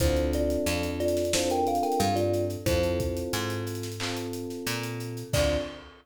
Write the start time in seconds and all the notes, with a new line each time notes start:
0.00 D2 C4 D4 E4 F4 A4 C5, kick, closed hi-hat
0.17 closed hi-hat
0.33 F4 D5, closed hi-hat
0.50 closed hi-hat
0.66 F2, closed hi-hat
0.83 closed hi-hat
1.00 F4 D5, closed hi-hat
1.08 closed hi-hat
1.17 snare, closed hi-hat
1.25 closed hi-hat
1.33 C4 D4 E4 F4 A4 C5, snare
1.50 A#4 G5, closed hi-hat
1.67 A4 F5, closed hi-hat
1.75 closed hi-hat
1.83 A#4 G5, closed hi-hat
1.92 closed hi-hat
2.00 G2 A4 F5, closed hi-hat
2.16 F4 D5, closed hi-hat
2.33 closed hi-hat
2.50 closed hi-hat
2.66 F2 C4 E4 F4 A4 C5, kick, closed hi-hat
2.83 closed hi-hat
3.00 kick, closed hi-hat
3.17 closed hi-hat
3.33 G#2, closed hi-hat
3.50 closed hi-hat
3.67 closed hi-hat
3.75 closed hi-hat
3.83 snare, closed hi-hat
3.92 closed hi-hat
4.00 C4 F4 A4, clap
4.17 closed hi-hat
4.33 closed hi-hat
4.50 snare, closed hi-hat
4.67 A#2, closed hi-hat
4.83 closed hi-hat
5.00 closed hi-hat
5.17 closed hi-hat
5.33 D2 C4 D4 F4 A4 D5, kick, crash